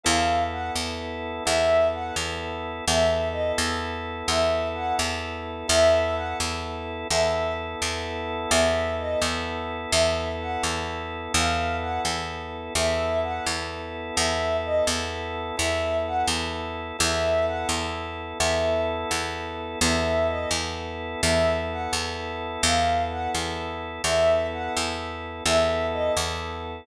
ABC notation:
X:1
M:6/8
L:1/8
Q:3/8=85
K:Elyd
V:1 name="Ocarina"
^e2 f z3 | e2 f z3 | e2 d z3 | e2 f z3 |
e2 f z3 | e2 z4 | e2 d z3 | e2 f z3 |
^e2 f z3 | e2 f z3 | e2 d z3 | e2 f z3 |
e2 f z3 | e2 z4 | e2 d z3 | e2 f z3 |
^e2 f z3 | e2 f z3 | e2 d z3 |]
V:2 name="Electric Bass (finger)" clef=bass
E,,3 E,,3 | E,,3 E,,3 | E,,3 E,,3 | E,,3 E,,3 |
E,,3 E,,3 | E,,3 E,,3 | E,,3 E,,3 | E,,3 E,,3 |
E,,3 E,,3 | E,,3 E,,3 | E,,3 E,,3 | E,,3 E,,3 |
E,,3 E,,3 | E,,3 E,,3 | E,,3 E,,3 | E,,3 E,,3 |
E,,3 E,,3 | E,,3 E,,3 | E,,3 E,,3 |]
V:3 name="Drawbar Organ"
[B,E=A]6 | [B,E=A]6 | [B,E=A]6 | [B,E=A]6 |
[B,E=A]6 | [B,E=A]6 | [B,E=A]6 | [B,E=A]6 |
[B,E=A]6 | [B,E=A]6 | [B,E=A]6 | [B,E=A]6 |
[B,E=A]6 | [B,E=A]6 | [B,E=A]6 | [B,E=A]6 |
[B,E=A]6 | [B,E=A]6 | [B,E=A]6 |]